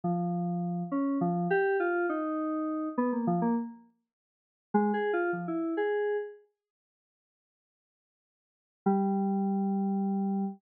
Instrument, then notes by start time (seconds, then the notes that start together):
electric piano 2
0.04 F3
0.92 C#4
1.21 F3
1.50 G4
1.80 F4
2.09 D#4
2.98 B3
3.12 A#3
3.27 F3
3.42 A#3
4.74 G#3
4.94 G#4
5.13 F4
5.33 F3
5.48 E4
5.77 G#4
8.86 G3